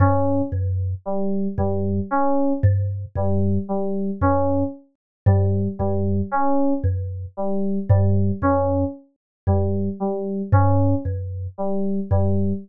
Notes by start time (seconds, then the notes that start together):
0.00 G2 C#4
0.52 F#2
1.05 G3
1.58 F#2 G3
2.11 C#4
2.63 G2
3.16 F#2 G3
3.69 G3
4.21 F#2 C#4
5.26 G2 G3
5.79 F#2 G3
6.32 C#4
6.84 F#2
7.37 G3
7.89 G2 G3
8.42 F#2 C#4
9.47 F#2 G3
10.00 G3
10.52 G2 C#4
11.05 F#2
11.58 G3
12.11 F#2 G3